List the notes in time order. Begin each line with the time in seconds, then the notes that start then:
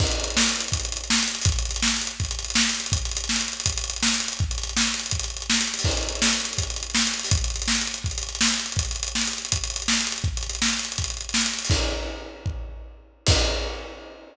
0.00 kick, crash
0.07 closed hi-hat
0.11 closed hi-hat
0.20 closed hi-hat
0.24 closed hi-hat
0.30 closed hi-hat
0.37 snare
0.42 closed hi-hat
0.49 closed hi-hat
0.56 closed hi-hat
0.60 closed hi-hat
0.68 closed hi-hat
0.72 kick, closed hi-hat
0.80 closed hi-hat
0.85 closed hi-hat
0.92 closed hi-hat
0.97 closed hi-hat
1.04 closed hi-hat
1.10 snare
1.15 closed hi-hat
1.23 closed hi-hat
1.28 closed hi-hat
1.35 closed hi-hat
1.41 closed hi-hat, open hi-hat
1.46 kick
1.52 closed hi-hat
1.59 closed hi-hat
1.65 closed hi-hat
1.71 closed hi-hat
1.76 closed hi-hat
1.82 snare
1.88 closed hi-hat
1.96 closed hi-hat
2.01 closed hi-hat
2.07 closed hi-hat
2.20 kick, closed hi-hat
2.25 closed hi-hat
2.31 closed hi-hat
2.39 closed hi-hat
2.44 closed hi-hat
2.50 closed hi-hat
2.55 snare
2.61 closed hi-hat
2.69 closed hi-hat
2.74 closed hi-hat
2.80 closed hi-hat
2.86 closed hi-hat
2.92 kick, closed hi-hat
2.98 closed hi-hat
3.05 closed hi-hat
3.11 closed hi-hat
3.17 closed hi-hat
3.24 closed hi-hat
3.29 snare
3.36 closed hi-hat
3.41 closed hi-hat
3.48 closed hi-hat
3.53 closed hi-hat
3.60 closed hi-hat
3.66 kick, closed hi-hat
3.72 closed hi-hat
3.77 closed hi-hat
3.84 closed hi-hat
3.90 closed hi-hat
3.96 closed hi-hat
4.03 snare
4.08 closed hi-hat
4.14 closed hi-hat
4.20 closed hi-hat
4.28 closed hi-hat
4.33 closed hi-hat
4.39 kick, closed hi-hat
4.51 closed hi-hat
4.58 closed hi-hat
4.63 closed hi-hat
4.69 closed hi-hat
4.77 snare
4.82 closed hi-hat
4.87 closed hi-hat
4.94 closed hi-hat
4.99 closed hi-hat
5.06 closed hi-hat
5.11 kick, closed hi-hat
5.19 closed hi-hat
5.24 closed hi-hat
5.30 closed hi-hat
5.37 closed hi-hat
5.42 closed hi-hat
5.50 snare
5.54 closed hi-hat
5.61 closed hi-hat
5.67 closed hi-hat
5.74 closed hi-hat
5.79 open hi-hat
5.84 kick, crash
5.91 closed hi-hat
5.97 closed hi-hat
6.03 closed hi-hat
6.09 closed hi-hat
6.15 closed hi-hat
6.22 snare
6.29 closed hi-hat
6.33 closed hi-hat
6.40 closed hi-hat
6.45 closed hi-hat
6.53 closed hi-hat
6.58 kick, closed hi-hat
6.63 closed hi-hat
6.70 closed hi-hat
6.76 closed hi-hat
6.83 closed hi-hat
6.90 closed hi-hat
6.95 snare
7.01 closed hi-hat
7.07 closed hi-hat
7.14 closed hi-hat
7.19 closed hi-hat
7.24 open hi-hat
7.31 kick, closed hi-hat
7.37 closed hi-hat
7.44 closed hi-hat
7.50 closed hi-hat
7.56 closed hi-hat
7.62 closed hi-hat
7.68 snare
7.75 closed hi-hat
7.81 closed hi-hat
7.87 closed hi-hat
7.94 closed hi-hat
8.04 kick, closed hi-hat
8.11 closed hi-hat
8.18 closed hi-hat
8.23 closed hi-hat
8.29 closed hi-hat
8.35 closed hi-hat
8.41 snare
8.48 closed hi-hat
8.54 closed hi-hat
8.59 closed hi-hat
8.66 closed hi-hat
8.72 closed hi-hat
8.77 kick, closed hi-hat
8.85 closed hi-hat
8.91 closed hi-hat
8.96 closed hi-hat
9.03 closed hi-hat
9.08 closed hi-hat
9.15 snare
9.21 closed hi-hat
9.27 closed hi-hat
9.33 closed hi-hat
9.38 closed hi-hat
9.45 closed hi-hat
9.52 kick, closed hi-hat
9.57 closed hi-hat
9.64 closed hi-hat
9.70 closed hi-hat
9.76 closed hi-hat
9.82 closed hi-hat
9.88 snare
9.93 closed hi-hat
10.01 closed hi-hat
10.07 closed hi-hat
10.12 closed hi-hat
10.18 closed hi-hat
10.24 kick, closed hi-hat
10.37 closed hi-hat
10.43 closed hi-hat
10.49 closed hi-hat
10.55 closed hi-hat
10.62 snare
10.68 closed hi-hat
10.73 closed hi-hat
10.79 closed hi-hat
10.85 closed hi-hat
10.92 closed hi-hat
10.98 kick, closed hi-hat
11.04 closed hi-hat
11.10 closed hi-hat
11.17 closed hi-hat
11.21 closed hi-hat
11.29 closed hi-hat
11.34 snare
11.41 closed hi-hat
11.46 closed hi-hat
11.53 closed hi-hat
11.59 closed hi-hat
11.65 open hi-hat
11.70 kick, crash
12.46 kick
13.27 kick, crash